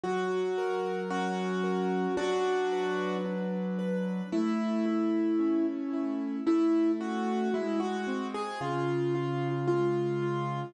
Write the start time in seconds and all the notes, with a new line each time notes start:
0.04 F#3 F#4
0.58 A#4
1.10 C#4 F#4
1.64 A#4
2.17 F#3 D4 F#4
2.72 B4
3.25 D4
3.79 B4
4.32 A3 E4
4.86 E4
5.39 C#4
5.93 E4
6.46 A3 E4
7.00 C#4 F#4
7.54 G#3 E4
7.80 F#4
8.07 C4
8.34 G#4
8.61 C#3 F4
9.15 F4
9.68 G#3 F4
10.22 F4